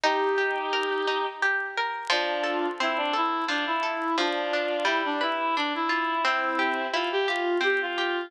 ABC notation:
X:1
M:3/4
L:1/16
Q:1/4=87
K:Bb
V:1 name="Violin"
[EG]8 z4 | [K:F] [DF]4 E D E2 D E3 | [DF]4 E D E2 D E3 | [CE]4 F G F2 G F3 |]
V:2 name="Pizzicato Strings"
E2 G2 B2 E2 G2 B2 | [K:F] F,2 A2 C2 A2 F,2 A2 | F,2 D2 G,2 =B2 D2 F2 | C2 G2 E2 G2 C2 G2 |]